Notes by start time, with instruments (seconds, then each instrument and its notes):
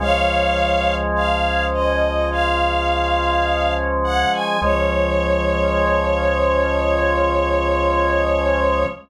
0.00 synth bass 1 C#2, drawbar organ F3 G#3 C#4, string ensemble 1 C#5 F5
1.15 string ensemble 1 F5
1.73 string ensemble 1 D#5
2.31 string ensemble 1 F5
4.04 string ensemble 1 F#5
4.33 string ensemble 1 G#5
4.62 synth bass 1 C#2, drawbar organ F3 G#3 C#4, string ensemble 1 C#5